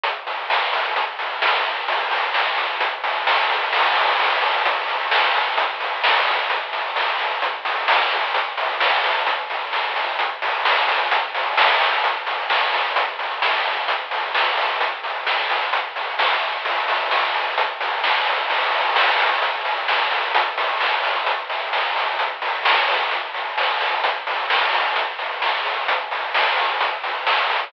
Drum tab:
CC |--------|--------|x-------|--------|
HH |xo-oxo--|oo-oxo-o|-o-oxo-o|xo-oxo-o|
SD |--o---o-|--o---o-|--o---o-|--o---o-|
BD |o-o-o-o-|o-o-o-o-|o-o-o-o-|o-o-o-o-|

CC |--------|--------|--------|--------|
HH |xo-oxo-o|xo-oxo-o|xo-oxo-o|xo-oxo-o|
SD |--o---o-|--o---o-|--o---o-|--o---o-|
BD |o-o-o-o-|o-o-o-o-|o-o-o-o-|o-o-o-o-|

CC |--------|--------|x-------|--------|
HH |xo-oxo--|oo-oxo-o|-o-oxo-o|xo-oxo-o|
SD |--o---o-|--o---o-|--o---o-|--o---o-|
BD |o-o-o-o-|o-o-o-o-|o-o-o-o-|o-o-o-o-|

CC |--------|--------|--------|
HH |xo-oxo-o|xo-oxo-o|xo-oxo-o|
SD |--o---o-|--o---o-|--o---o-|
BD |o-o-o-o-|o-o-o-o-|o-o-o-o-|